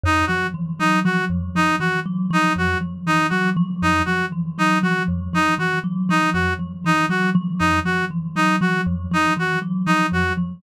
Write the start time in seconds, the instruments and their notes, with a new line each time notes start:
0.03 kalimba F2, clarinet D#4
0.27 kalimba F3, clarinet F#4
0.54 kalimba E3
0.79 kalimba F#3, clarinet D#4
1.05 kalimba F3, clarinet F#4
1.30 kalimba F2
1.55 kalimba F3, clarinet D#4
1.80 kalimba E3, clarinet F#4
2.06 kalimba F#3
2.31 kalimba F3, clarinet D#4
2.56 kalimba F2, clarinet F#4
2.81 kalimba F3
3.07 kalimba E3, clarinet D#4
3.30 kalimba F#3, clarinet F#4
3.57 kalimba F3
3.82 kalimba F2, clarinet D#4
4.05 kalimba F3, clarinet F#4
4.32 kalimba E3
4.58 kalimba F#3, clarinet D#4
4.83 kalimba F3, clarinet F#4
5.08 kalimba F2
5.33 kalimba F3, clarinet D#4
5.58 kalimba E3, clarinet F#4
5.84 kalimba F#3
6.09 kalimba F3, clarinet D#4
6.33 kalimba F2, clarinet F#4
6.59 kalimba F3
6.84 kalimba E3, clarinet D#4
7.09 kalimba F#3, clarinet F#4
7.35 kalimba F3
7.59 kalimba F2, clarinet D#4
7.85 kalimba F3, clarinet F#4
8.11 kalimba E3
8.36 kalimba F#3, clarinet D#4
8.61 kalimba F3, clarinet F#4
8.86 kalimba F2
9.11 kalimba F3, clarinet D#4
9.37 kalimba E3, clarinet F#4
9.62 kalimba F#3
9.86 kalimba F3, clarinet D#4
10.12 kalimba F2, clarinet F#4
10.37 kalimba F3